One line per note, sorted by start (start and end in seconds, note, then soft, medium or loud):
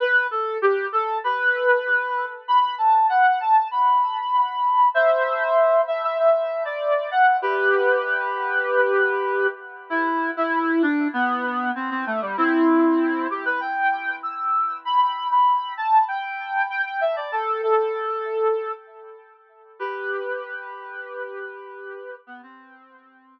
0.00 0.27 B4 loud
0.31 0.57 A4 medium
0.62 0.87 G4 medium
0.92 1.18 A4 medium
1.24 2.26 B4 medium
2.48 2.75 B5 loud
2.78 3.06 A5 medium
3.09 3.39 F#5 medium
3.40 3.68 A5 medium
3.71 4.88 B5 medium
4.94 5.81 C5 medium
4.94 5.81 E5 medium
5.87 6.02 E5 medium
6.03 6.18 E5 medium
6.19 6.63 E5 medium
6.65 7.10 D5 medium
7.11 7.36 F#5 medium
7.42 9.47 G4 medium
7.42 9.47 B4 medium
9.90 10.31 E4 medium
10.37 10.82 E4 medium
10.82 11.08 D4 medium
11.13 11.71 B3 medium
11.75 11.90 C4 medium
11.90 12.05 C4 medium
12.06 12.21 A3 medium
12.21 12.36 G3 medium
12.37 13.27 C4 medium
12.37 13.27 E4 medium
13.30 13.45 G4 medium
13.45 13.60 B4 medium
13.61 14.15 G5 medium
14.23 14.77 E6 medium
14.85 15.27 B5 medium
15.31 15.73 B5 medium
15.77 16.04 A5 medium
16.08 16.66 G5 medium
16.70 16.85 G5 medium
16.85 17.00 G5 medium
17.01 17.16 E5 medium
17.16 17.31 D5 medium
17.32 17.61 A4 medium
17.63 18.72 A4 medium
19.79 22.15 G4 medium
19.79 22.15 B4 medium
22.27 22.41 B3 medium
22.43 23.39 C4 medium